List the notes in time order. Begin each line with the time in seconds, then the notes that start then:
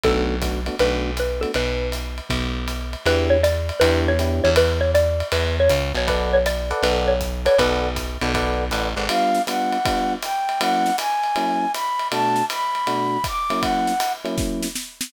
0.03 B1 A3 B3 D4 F#4 A4, kick, ride
0.41 A3 B3 D4 F#4, kick, hi-hat pedal, ride
0.66 A3 B3 D4 F#4, ride
0.79 B1 A3 B3 D4 F#4 B4, ride
1.17 B4, hi-hat pedal, ride
1.41 A3 B3 D4 F#4 A4, ride
1.54 B1 B4, ride
1.92 hi-hat pedal, ride
2.18 ride
2.29 B1, kick, ride
2.68 hi-hat pedal, ride
2.93 ride
3.06 E2 B3 D4 E4 G4 B4, ride
3.30 C#5
3.43 D5, hi-hat pedal, ride
3.69 ride
3.80 E2 B3 D4 E4 G4 B4, ride
4.08 C#5
4.19 B3 D4 E4 G4, hi-hat pedal, ride
4.44 E2 C#5, ride
4.56 B4, ride
4.81 C#5
4.94 D5, hi-hat pedal, ride
5.20 ride
5.32 E2 B4, ride
5.60 C#5
5.69 C#2, hi-hat pedal, ride
5.94 B1 C#5, ride
6.07 A4 B4 D5 F#5, kick, ride
6.33 C#5
6.46 D5, hi-hat pedal, ride
6.70 A4 B4 D5 F#5, ride
6.83 B1 B4, ride
7.08 C#5
7.20 kick, hi-hat pedal
7.45 A4 B4 C#5 D5 F#5, ride
7.58 B1 A4 B4 D5 F#5, kick, ride
7.96 kick, hi-hat pedal, ride
8.21 B1 A4 B4 D5 F#5, ride
8.34 A4 B4 D5 F#5, kick, ride
8.71 A1 A4 B4 D5 F#5, hi-hat pedal, ride
8.96 G#1 A4 B4 D5 F#5, ride
9.09 G3 B3 D4 F4 F5, ride
9.35 snare
9.47 G3 B3 D4 F4 F#5, hi-hat pedal, ride
9.72 ride
9.85 G3 B3 D4 F4, kick, ride
10.22 G5, hi-hat pedal, ride
10.49 ride
10.60 F#3 A#3 C#4 E4 F#5, ride
10.86 snare
10.98 G#5, hi-hat pedal, ride
11.24 ride
11.36 F#3 A#3 C#4 E4, ride
11.74 B5, hi-hat pedal, ride
11.99 ride
12.12 B2 A3 D4 F#4 A5, ride
12.36 snare
12.50 B5, hi-hat pedal, ride
12.75 ride
12.87 B2 A3 D4 F#4, ride
13.24 D6, kick, hi-hat pedal, ride
13.50 F#3 A#3 C#4 E4, ride
13.61 F#5, kick, ride
13.87 snare
14.00 hi-hat pedal, ride
14.25 F#3 A#3 C#4 E4, ride
14.38 kick, snare
14.62 snare
14.75 snare
15.01 snare